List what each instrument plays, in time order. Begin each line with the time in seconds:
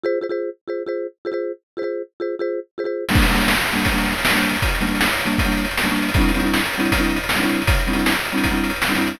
0.04 marimba F4 G#4 C5
0.21 marimba F4 G#4 C5
0.29 marimba F4 G#4 C5
0.68 marimba F4 G#4 C5
0.86 marimba F4 G#4 C5
1.25 marimba F4 G#4 C5
1.32 marimba F4 G#4 C5
1.77 marimba F4 G#4 C5
1.82 marimba F4 G#4 C5
2.20 marimba F4 G#4 C5
2.39 marimba F4 G#4 C5
2.78 marimba F4 G#4 C5
2.84 marimba F4 G#4 C5
3.09 marimba G3 A#3 D4, crash
3.15 kick, closed hi-hat
3.22 closed hi-hat
3.29 marimba G3 A#3 D4, closed hi-hat
3.34 marimba G3 A#3 D4, closed hi-hat
3.41 closed hi-hat
3.48 snare
3.55 closed hi-hat
3.61 closed hi-hat
3.67 closed hi-hat
3.73 marimba G3 A#3 D4, closed hi-hat
3.79 closed hi-hat
3.85 kick, closed hi-hat
3.92 marimba G3 A#3 D4, closed hi-hat
3.98 closed hi-hat
4.05 closed hi-hat
4.11 closed hi-hat
4.18 closed hi-hat
4.25 snare
4.29 marimba G3 A#3 D4, closed hi-hat
4.36 marimba G3 A#3 D4, closed hi-hat
4.43 closed hi-hat
4.49 closed hi-hat
4.55 closed hi-hat
4.62 kick, closed hi-hat
4.69 closed hi-hat
4.75 closed hi-hat
4.81 marimba G3 A#3 D4, closed hi-hat
4.87 marimba G3 A#3 D4, closed hi-hat
4.95 closed hi-hat
5.01 snare
5.06 closed hi-hat
5.13 closed hi-hat
5.19 closed hi-hat
5.25 marimba G3 A#3 D4, closed hi-hat
5.32 closed hi-hat
5.38 kick, closed hi-hat
5.45 marimba G3 A#3 D4, closed hi-hat
5.52 closed hi-hat
5.57 closed hi-hat
5.65 closed hi-hat
5.71 closed hi-hat
5.77 snare
5.83 marimba G3 A#3 D4, closed hi-hat
5.90 marimba G3 A#3 D4, closed hi-hat
5.96 closed hi-hat
6.02 closed hi-hat
6.09 closed hi-hat
6.14 marimba G3 C4, kick, closed hi-hat
6.19 marimba D4 E4, closed hi-hat
6.28 closed hi-hat
6.34 marimba G3 C4 D4 E4, closed hi-hat
6.40 marimba G3 C4 D4, closed hi-hat
6.44 marimba E4, closed hi-hat
6.54 snare
6.59 closed hi-hat
6.66 closed hi-hat
6.73 closed hi-hat
6.78 marimba G3 C4 D4 E4, closed hi-hat
6.85 closed hi-hat
6.92 kick, closed hi-hat
6.98 marimba G3 C4 D4 E4, closed hi-hat
7.04 closed hi-hat
7.10 closed hi-hat
7.16 closed hi-hat
7.23 closed hi-hat
7.29 snare
7.36 marimba G3 C4 D4 E4, closed hi-hat
7.42 marimba G3 C4 D4 E4, closed hi-hat
7.49 closed hi-hat
7.54 closed hi-hat
7.62 closed hi-hat
7.67 kick, closed hi-hat
7.75 closed hi-hat
7.80 closed hi-hat
7.87 marimba G3 C4 D4 E4, closed hi-hat
7.93 marimba G3 C4 D4 E4, closed hi-hat
7.99 closed hi-hat
8.06 snare
8.12 closed hi-hat
8.19 closed hi-hat
8.25 closed hi-hat
8.32 marimba G3 C4 D4 E4, closed hi-hat
8.38 closed hi-hat
8.44 kick, closed hi-hat
8.51 marimba G3 C4 D4 E4, closed hi-hat
8.57 closed hi-hat
8.64 closed hi-hat
8.70 closed hi-hat
8.76 closed hi-hat
8.82 snare
8.88 marimba G3 C4 D4 E4, closed hi-hat
8.95 marimba G3 C4 D4 E4, closed hi-hat
9.01 closed hi-hat
9.07 closed hi-hat
9.14 closed hi-hat